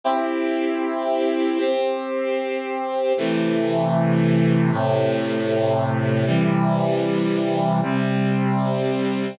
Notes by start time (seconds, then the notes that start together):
0.04 C4 E4 G4
1.59 C4 G4 C5
3.17 C3 E3 A3
4.71 A2 C3 A3
6.26 C3 E3 G3
7.82 C3 G3 C4